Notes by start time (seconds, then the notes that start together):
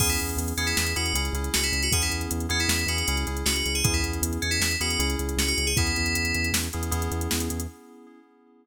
0.00 E2 B3 C#4 E4 G#4, kick, crash
0.10 E4, closed hi-hat
0.19 E2, closed hi-hat
0.29 closed hi-hat
0.37 E2, closed hi-hat
0.48 closed hi-hat
0.57 E2 B3 C#4 E4 G#4, closed hi-hat
0.67 E4, closed hi-hat
0.77 E2, snare
0.86 closed hi-hat
0.96 E2 B3 C#4 E4 F#4 G#4, closed hi-hat
1.06 closed hi-hat
1.14 C#2 C#4 E4 G#4, closed hi-hat
1.25 closed hi-hat
1.33 C#2 C#4 E4 G#4, closed hi-hat
1.44 closed hi-hat
1.54 C#2 F#4, snare
1.64 E4, closed hi-hat
1.72 C#2, closed hi-hat
1.83 F#4, closed hi-hat
1.91 E2 B3 C#4 E4 G#4, kick, closed hi-hat
2.02 E4, closed hi-hat
2.10 E2, closed hi-hat
2.21 closed hi-hat
2.31 E2, closed hi-hat
2.40 closed hi-hat
2.49 E2 B3 C#4 E4 G#4, closed hi-hat
2.60 E4, closed hi-hat
2.68 E2, snare
2.79 closed hi-hat
2.86 E2 B3 C#4 E4 F#4 G#4, closed hi-hat
2.98 closed hi-hat
3.08 C#2 C#4 E4 G#4, closed hi-hat
3.17 closed hi-hat
3.27 C#2 C#4 E4 G#4, closed hi-hat
3.37 closed hi-hat
3.46 C#2 F#4, snare
3.56 F#4, closed hi-hat
3.66 C#2, closed hi-hat
3.75 G#4, closed hi-hat
3.84 E2 B3 C#4 E4 G#4, kick, closed hi-hat
3.94 E4, closed hi-hat
4.03 E2, closed hi-hat
4.13 closed hi-hat
4.22 E2, closed hi-hat
4.33 closed hi-hat
4.42 E2 C#4, closed hi-hat
4.51 E4, closed hi-hat
4.60 E2, snare
4.71 closed hi-hat
4.80 E2 B3 C#4 E4 F#4 G#4, closed hi-hat
4.90 closed hi-hat
4.99 C#2 C#4 E4 G#4, closed hi-hat
5.10 closed hi-hat
5.19 C#2, closed hi-hat
5.29 closed hi-hat
5.37 C#2 F#4, snare
5.48 F#4, closed hi-hat
5.58 C#2, closed hi-hat
5.67 G#4, closed hi-hat
5.76 E2 B3 C#4 E4 G#4, kick, closed hi-hat
5.87 closed hi-hat
5.96 E2, closed hi-hat
6.06 closed hi-hat
6.15 E2, closed hi-hat
6.25 closed hi-hat
6.34 E2, closed hi-hat
6.44 closed hi-hat
6.53 E2, snare
6.63 closed hi-hat
6.73 E2 B3 C#4 E4 G#4, closed hi-hat
6.83 closed hi-hat
6.91 E2 B3 C#4 E4 G#4, closed hi-hat
7.02 closed hi-hat
7.11 E2, closed hi-hat
7.21 closed hi-hat
7.31 E2, snare
7.40 closed hi-hat
7.50 E2, closed hi-hat
7.60 closed hi-hat